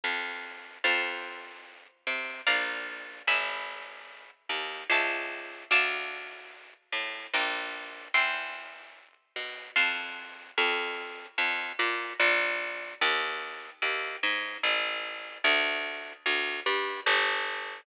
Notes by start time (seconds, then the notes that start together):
0.04 F2
0.84 F2 C5 F5 A5
2.07 C3
2.47 A#1 D5 F5 A#5
3.27 G#1 E5 G#5 B5
4.49 D#2
4.90 C#2 E5 A5 C#6
5.71 D2 F5 A5 D6
6.92 A2
7.33 A#1 G5 A#5 D6
8.14 E2 G5 C6 E6
9.36 B2
9.76 F2 F5 A5 C6
10.58 F2
11.38 F2
11.79 A#2
12.20 A#1
13.01 D#2
13.82 D#2
14.23 G#2
14.63 A1
15.44 D2
16.26 D2
16.66 G2
17.06 G1